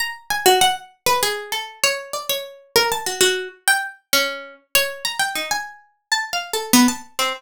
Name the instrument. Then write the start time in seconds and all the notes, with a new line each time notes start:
pizzicato strings
0.00 A#5
0.30 G#5
0.46 F#4
0.61 F#5
1.06 B4
1.23 G#4
1.52 A4
1.84 C#5
2.13 D5
2.29 C#5
2.76 A#4
2.92 A5
3.06 F#4
3.21 F#4
3.68 G5
4.13 C#4
4.75 C#5
5.05 A#5
5.19 G5
5.35 D#4
5.51 G#5
6.12 A5
6.33 F5
6.53 A4
6.73 B3
6.88 A5
7.19 C4